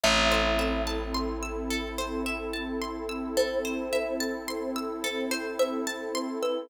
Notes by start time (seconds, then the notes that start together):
0.03 A1 C4 E4 A4 E5
0.32 C5
0.59 E5
0.87 A5
1.15 C6
1.43 E6
1.71 A4
1.98 C5
2.26 E5
2.53 A5
2.82 C6
3.09 E6
3.37 A4 C5
3.65 C5
3.93 E5
4.20 A5
4.48 C6
4.76 E6
5.04 A4
5.31 C5
5.59 C5 E5
5.87 A5
6.15 C6
6.43 B4 E6